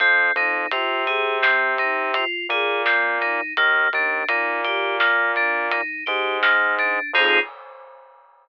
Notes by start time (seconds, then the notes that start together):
0.00 F2 C4, kick, closed hi-hat
0.36 F2 D#4, closed hi-hat
0.71 C3 F4, closed hi-hat
1.07 G#4, closed hi-hat
1.42 C4, snare
1.78 D#4, closed hi-hat
2.14 F4, closed hi-hat
2.49 A#2 G#4, closed hi-hat
2.86 C4, snare
3.21 D#4, closed hi-hat
3.57 D#2 A#3, kick, closed hi-hat
3.93 D#2 D4, closed hi-hat
4.28 A#2 D#4, closed hi-hat
4.64 G4, closed hi-hat
5.00 A#3, snare
5.36 D4, closed hi-hat
5.71 D#4, closed hi-hat
6.06 G#2 G4, closed hi-hat
6.43 A#3, snare
6.79 D4, closed hi-hat
7.13 F2 C4 D#4 F4 G#4, kick, crash